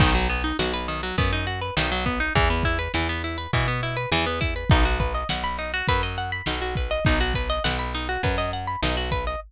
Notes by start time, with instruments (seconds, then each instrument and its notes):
0.00 electric bass (finger) B1, acoustic guitar (steel) D#3, kick, crash
0.15 acoustic guitar (steel) F#3
0.29 acoustic guitar (steel) B3, closed hi-hat
0.44 acoustic guitar (steel) D#4
0.59 electric bass (finger) B1, acoustic guitar (steel) F#4, snare
0.74 acoustic guitar (steel) B4
0.88 acoustic guitar (steel) D#3, closed hi-hat
1.03 acoustic guitar (steel) F#3
1.17 electric bass (finger) F#2, acoustic guitar (steel) B3, kick, closed hi-hat
1.33 acoustic guitar (steel) D#4
1.47 acoustic guitar (steel) F#4, closed hi-hat
1.61 acoustic guitar (steel) B4
1.77 electric bass (finger) B1, acoustic guitar (steel) D#3, snare
1.92 acoustic guitar (steel) F#3
2.05 acoustic guitar (steel) B3, kick, closed hi-hat
2.20 acoustic guitar (steel) D#4
2.35 electric bass (finger) E2, acoustic guitar (steel) E3, kick, closed hi-hat
2.50 acoustic guitar (steel) B3
2.63 acoustic guitar (steel) E4, kick, closed hi-hat
2.79 acoustic guitar (steel) B4
2.94 electric bass (finger) E2, acoustic guitar (steel) E3, snare
3.09 acoustic guitar (steel) B3
3.24 acoustic guitar (steel) E4, closed hi-hat
3.38 acoustic guitar (steel) B4
3.53 electric bass (finger) B2, acoustic guitar (steel) E3, kick, closed hi-hat
3.68 acoustic guitar (steel) B3
3.83 acoustic guitar (steel) E4, closed hi-hat
3.97 acoustic guitar (steel) B4
4.12 electric bass (finger) E2, acoustic guitar (steel) E3, snare
4.26 acoustic guitar (steel) B3
4.40 acoustic guitar (steel) E4, kick, closed hi-hat
4.56 acoustic guitar (steel) B4
4.70 electric bass (finger) B1, acoustic guitar (steel) D#4, kick, closed hi-hat
4.85 acoustic guitar (steel) F#4
5.00 acoustic guitar (steel) B4, kick, closed hi-hat
5.15 acoustic guitar (steel) D#5
5.29 electric bass (finger) B1, acoustic guitar (steel) F#5, snare
5.44 acoustic guitar (steel) B5
5.58 acoustic guitar (steel) D#4, closed hi-hat
5.74 acoustic guitar (steel) F#4
5.87 electric bass (finger) F#2, acoustic guitar (steel) B4, kick, closed hi-hat
6.03 acoustic guitar (steel) D#5
6.18 acoustic guitar (steel) F#5, closed hi-hat
6.32 acoustic guitar (steel) B5
6.46 electric bass (finger) B1, acoustic guitar (steel) D#4, snare
6.62 acoustic guitar (steel) F#4
6.75 acoustic guitar (steel) B4, kick, closed hi-hat
6.91 acoustic guitar (steel) D#5
7.05 electric bass (finger) B1, acoustic guitar (steel) D#4, kick, closed hi-hat
7.21 acoustic guitar (steel) F#4
7.34 acoustic guitar (steel) B4, kick, closed hi-hat
7.50 acoustic guitar (steel) D#5
7.64 electric bass (finger) B1, acoustic guitar (steel) F#5, snare
7.79 acoustic guitar (steel) B5
7.94 acoustic guitar (steel) D#4, closed hi-hat
8.09 acoustic guitar (steel) F#4
8.23 electric bass (finger) F#2, acoustic guitar (steel) B4, kick, closed hi-hat
8.38 acoustic guitar (steel) D#5
8.53 acoustic guitar (steel) F#5, closed hi-hat
8.67 acoustic guitar (steel) B5
8.82 electric bass (finger) B1, acoustic guitar (steel) D#4, snare
8.97 acoustic guitar (steel) F#4
9.12 acoustic guitar (steel) B4, kick, closed hi-hat
9.27 acoustic guitar (steel) D#5